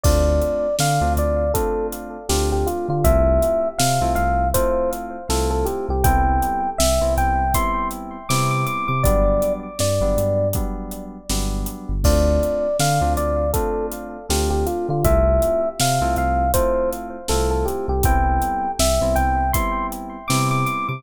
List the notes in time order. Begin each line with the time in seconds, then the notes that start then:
0.03 D2 A3 C4 D4 F4 D5, kick, crash
0.42 closed hi-hat
0.79 D3 F5, snare
1.01 D2 A3 C4 D4 F4
1.17 D2 D5, closed hi-hat
1.54 A3 C4 D4 F4 A4, kick, closed hi-hat
1.92 closed hi-hat
2.29 D2 A3 C4 D4 F4 G4, snare
2.52 G4
2.67 F4, closed hi-hat
2.88 D3 F4
3.04 C2 A3 C4 E4 F4 E5, kick, closed hi-hat
3.42 closed hi-hat
3.78 C3 F5, snare
4.01 C2 A3 C4 E4 F4
4.15 C2 F5, closed hi-hat
4.54 A3 C4 E4 F4 C5, kick, closed hi-hat
4.93 closed hi-hat
5.29 C2 A3 C4 E4 F4 A4, snare
5.50 A4
5.65 G4, closed hi-hat
5.89 C2 G4
6.04 C2 G3 B3 C4 E4 G5, kick, closed hi-hat
6.42 closed hi-hat
6.78 C2 E5, snare
7.01 C2 G3 B3 C4 E4
7.17 C2 G5, closed hi-hat
7.54 G3 B3 C4 E4 C6, kick, closed hi-hat
7.91 closed hi-hat
8.29 C3 G3 B3 C4 E4 D6, snare
8.51 D6
8.66 D6, closed hi-hat
8.88 C3 D6
9.03 G1 F#3 G3 B3 D4 D5, kick, closed hi-hat
9.42 closed hi-hat
9.79 G2 D5, snare
10.01 G1 F#3 G3 B3 D4
10.17 G2, closed hi-hat
10.53 F#3 G3 B3 D4, kick, closed hi-hat
10.91 closed hi-hat
11.29 G1 F#3 G3 B3 D4, snare
11.66 closed hi-hat
11.89 G1
12.04 D2 A3 C4 D4 F4 D5, kick, crash
12.43 closed hi-hat
12.79 D3 F5, snare
13.01 D2 A3 C4 D4 F4
13.17 D2 D5, closed hi-hat
13.53 A3 C4 D4 F4 A4, kick, closed hi-hat
13.92 closed hi-hat
14.29 D2 A3 C4 D4 F4 G4, snare
14.50 G4
14.66 F4, closed hi-hat
14.89 D3 F4
15.04 C2 A3 C4 E4 F4 E5, kick, closed hi-hat
15.42 closed hi-hat
15.80 C3 F5, snare
16.01 C2 A3 C4 E4 F4
16.16 C2 F5, closed hi-hat
16.54 A3 C4 E4 F4 C5, kick, closed hi-hat
16.93 closed hi-hat
17.28 C2 A3 C4 E4 F4 A4, snare
17.51 A4
17.65 G4, closed hi-hat
17.88 C2 G4
18.03 C2 G3 B3 C4 E4 G5, kick, closed hi-hat
18.42 closed hi-hat
18.79 C2 E5, snare
19.01 C2 G3 B3 C4 E4
19.15 C2 G5, closed hi-hat
19.53 G3 B3 C4 E4 C6, kick, closed hi-hat
19.92 closed hi-hat
20.28 C3 G3 B3 C4 E4 D6, snare
20.51 D6
20.66 D6, closed hi-hat
20.89 C3 D6